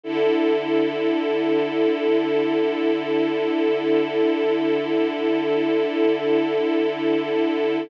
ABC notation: X:1
M:4/4
L:1/8
Q:1/4=61
K:Dlyd
V:1 name="String Ensemble 1"
[D,EA]8- | [D,EA]8 |]